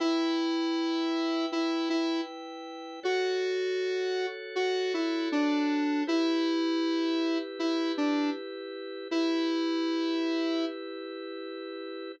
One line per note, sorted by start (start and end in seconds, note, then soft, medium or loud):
0.00 3.00 E4 medium
0.00 1.46 E4 medium
0.00 3.00 B4 medium
0.00 3.00 G5 medium
1.52 1.89 E4 medium
1.90 2.21 E4 medium
3.03 6.04 F#4 medium
3.03 4.26 F#4 medium
3.03 6.04 A4 medium
3.03 6.04 C#5 medium
4.56 4.93 F#4 medium
4.94 5.29 E4 medium
5.32 6.03 D4 medium
6.07 9.08 E4 medium
6.07 7.38 E4 medium
6.07 9.08 G4 medium
6.07 9.08 B4 medium
7.59 7.92 E4 medium
7.97 8.30 D4 medium
9.11 12.12 E4 medium
9.11 10.65 E4 medium
9.11 12.12 G4 medium
9.11 12.12 B4 medium